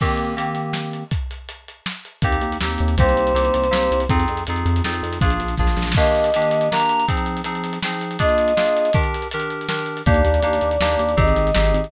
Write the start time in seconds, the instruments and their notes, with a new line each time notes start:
0.00 electric piano 2 D#3 A#3 C4 G4, kick, crash
0.17 closed hi-hat
0.36 electric piano 2 D#3 A#3 C4 G4, closed hi-hat
0.55 closed hi-hat
0.73 snare
0.93 closed hi-hat
1.11 kick, closed hi-hat
1.31 closed hi-hat
1.49 closed hi-hat
1.68 closed hi-hat
1.86 snare
2.05 closed hi-hat
2.22 synth bass 1 D#2, electric piano 2 A#3 C4 D#4 G4, kick, closed hi-hat
2.32 closed hi-hat
2.41 synth bass 1 D#2, closed hi-hat
2.52 closed hi-hat
2.61 synth bass 1 D#2, electric piano 2 A#3 C4 D#4 G4, snare
2.71 closed hi-hat
2.78 synth bass 1 D#2, closed hi-hat
2.88 closed hi-hat
2.98 synth bass 1 C2, electric piano 2 A#3 C4 D#4 G4, choir aahs C5, kick, closed hi-hat
3.09 closed hi-hat
3.16 synth bass 1 C2, closed hi-hat
3.27 closed hi-hat
3.34 synth bass 1 C2, electric piano 2 A#3 C4 D#4 G4, closed hi-hat
3.45 closed hi-hat
3.54 synth bass 1 C2, closed hi-hat
3.64 closed hi-hat
3.71 synth bass 1 C2, electric piano 2 A#3 C4 D#4 G4, snare
3.83 closed hi-hat
3.91 synth bass 1 C2, closed hi-hat
4.00 closed hi-hat
4.09 synth bass 1 F2, electric piano 2 C4 D#4 F4 G#4, kick, closed hi-hat
4.20 closed hi-hat
4.28 synth bass 1 F2, closed hi-hat
4.37 closed hi-hat
4.47 synth bass 1 F2, electric piano 2 C4 D#4 F4 G#4, closed hi-hat
4.56 closed hi-hat
4.66 synth bass 1 F2, closed hi-hat
4.76 closed hi-hat
4.84 synth bass 1 F2, electric piano 2 C4 D#4 F4 G#4, snare
4.94 closed hi-hat
5.03 synth bass 1 F2, closed hi-hat
5.13 closed hi-hat
5.21 synth bass 1 A#1, electric piano 2 A#3 D4 F4 G#4, kick, closed hi-hat
5.30 closed hi-hat
5.40 synth bass 1 A#1, closed hi-hat
5.48 closed hi-hat
5.57 synth bass 1 A#1, electric piano 2 A#3 D4 F4 G#4, kick, snare
5.67 snare
5.77 synth bass 1 A#1, snare
5.82 snare
5.87 snare
5.92 kick, snare
5.96 electric piano 2 D#3 A#3 D4 G4, choir aahs D#5, crash
6.04 closed hi-hat
6.15 closed hi-hat
6.24 closed hi-hat
6.34 electric piano 2 D#3 A#3 D4 G4, closed hi-hat
6.42 closed hi-hat
6.51 closed hi-hat
6.61 closed hi-hat
6.71 electric piano 2 D#3 A#3 D4 G4, choir aahs A#5, snare
6.80 closed hi-hat
6.89 closed hi-hat
7.00 closed hi-hat
7.08 electric piano 2 F3 C4 D#4 G#4, kick, closed hi-hat
7.17 closed hi-hat
7.26 closed hi-hat
7.37 closed hi-hat
7.44 electric piano 2 F3 C4 D#4 G#4, closed hi-hat
7.55 closed hi-hat
7.64 closed hi-hat
7.73 closed hi-hat
7.83 electric piano 2 F3 C4 D#4 G#4, snare
7.93 closed hi-hat
8.01 closed hi-hat
8.11 closed hi-hat
8.19 electric piano 2 A#3 D4 F4 G#4, choir aahs D#5, kick, closed hi-hat
8.29 closed hi-hat
8.38 closed hi-hat
8.48 closed hi-hat
8.56 electric piano 2 A#3 D4 F4 G#4, snare
8.66 closed hi-hat
8.77 closed hi-hat
8.85 closed hi-hat
8.93 electric piano 2 D#3 D4 G4 A#4, kick, closed hi-hat
9.03 closed hi-hat
9.14 closed hi-hat
9.22 closed hi-hat
9.31 electric piano 2 D#3 D4 G4 A#4, closed hi-hat
9.40 closed hi-hat
9.50 closed hi-hat
9.61 closed hi-hat
9.68 electric piano 2 D#3 D4 G4 A#4, snare
9.79 closed hi-hat
9.86 closed hi-hat
9.97 closed hi-hat
10.06 synth bass 1 D#2, electric piano 2 A#3 D4 D#4 G4, choir aahs D5, kick, closed hi-hat
10.14 closed hi-hat
10.25 synth bass 1 D#2, closed hi-hat
10.34 closed hi-hat
10.43 synth bass 1 D#2, electric piano 2 A#3 D4 D#4 G4, closed hi-hat
10.53 closed hi-hat
10.61 synth bass 1 D#2, closed hi-hat
10.71 closed hi-hat
10.80 synth bass 1 D#2, electric piano 2 A#3 D4 D#4 G4, snare
10.92 closed hi-hat
10.99 synth bass 1 D#2, closed hi-hat
11.09 closed hi-hat
11.17 synth bass 1 G#1, electric piano 2 C4 D#4 G4 G#4, choir aahs D#5, kick, closed hi-hat
11.28 closed hi-hat
11.36 synth bass 1 G#1, closed hi-hat
11.47 closed hi-hat
11.55 synth bass 1 G#1, electric piano 2 C4 D#4 G4 G#4, snare
11.65 closed hi-hat
11.74 synth bass 1 G#1, closed hi-hat
11.84 closed hi-hat